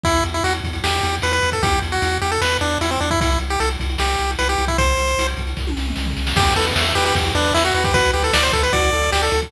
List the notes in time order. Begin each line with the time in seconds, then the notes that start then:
0.04 E2 E4, kick, closed hi-hat
0.15 closed hi-hat
0.24 E2, closed hi-hat
0.34 E4, closed hi-hat
0.44 E2 F#4, closed hi-hat
0.54 closed hi-hat
0.64 E2, kick, closed hi-hat
0.73 closed hi-hat
0.84 E2 G4, snare
0.92 closed hi-hat
1.03 E2, closed hi-hat
1.14 closed hi-hat
1.22 E2 B4, closed hi-hat
1.32 B4, closed hi-hat
1.42 E2, closed hi-hat
1.52 A4, kick, closed hi-hat
1.63 E2 G4, kick, closed hi-hat
1.73 closed hi-hat
1.82 E2, closed hi-hat
1.92 F#4, closed hi-hat
2.02 E2, closed hi-hat
2.12 closed hi-hat
2.22 E2 G4, closed hi-hat
2.31 A4, closed hi-hat
2.41 E2 B4, snare
2.51 closed hi-hat
2.61 E2 D4, closed hi-hat
2.70 closed hi-hat
2.81 E2 E4, closed hi-hat
2.91 C4, closed hi-hat
3.00 E2 D4, closed hi-hat
3.11 E4, kick, closed hi-hat
3.20 C2 E4, kick, closed hi-hat
3.30 closed hi-hat
3.39 C2, closed hi-hat
3.50 G4, closed hi-hat
3.60 C2 A4, closed hi-hat
3.71 closed hi-hat
3.80 C2, kick, closed hi-hat
3.89 closed hi-hat
3.98 C2 G4, snare
4.09 closed hi-hat
4.18 C2, closed hi-hat
4.30 closed hi-hat
4.39 C2 B4, closed hi-hat
4.49 G4, closed hi-hat
4.58 C2, closed hi-hat
4.68 E4, kick, closed hi-hat
4.78 C2 C5, kick, closed hi-hat
4.88 closed hi-hat
4.97 C2, closed hi-hat
5.07 closed hi-hat
5.18 C2, closed hi-hat
5.28 closed hi-hat
5.37 C2, kick, closed hi-hat
5.47 closed hi-hat
5.57 C2, kick, snare
5.67 high tom
5.77 C2, snare
5.88 mid tom
5.96 C2, snare
6.06 floor tom
6.17 C2, snare
6.27 snare
6.36 E2 G4, kick, crash
6.47 closed hi-hat
6.56 E2 A4 B4, closed hi-hat
6.66 closed hi-hat
6.76 E2 E5, snare
6.85 closed hi-hat
6.95 E2 G4 B4, closed hi-hat
7.06 G4, closed hi-hat
7.15 E2 G4, kick, closed hi-hat
7.25 closed hi-hat
7.35 E2 D4 B4, closed hi-hat
7.45 closed hi-hat
7.54 E2 E4 E5, snare
7.65 F#4, closed hi-hat
7.74 E2 F#4 B4, closed hi-hat
7.84 G4, kick, closed hi-hat
7.94 D2 F#4 B4, kick, closed hi-hat
8.04 closed hi-hat
8.13 D2 G4 B4, closed hi-hat
8.24 A4, closed hi-hat
8.33 D2 D5, snare
8.43 C5, closed hi-hat
8.52 D2 A4 B4, kick, closed hi-hat
8.63 B4, closed hi-hat
8.73 D2 F#4 D5, kick, closed hi-hat
8.83 closed hi-hat
8.93 D2 A4, closed hi-hat
9.02 closed hi-hat
9.12 D2 G4 D5, snare
9.23 A4, closed hi-hat
9.32 D2 A4, closed hi-hat
9.42 kick, open hi-hat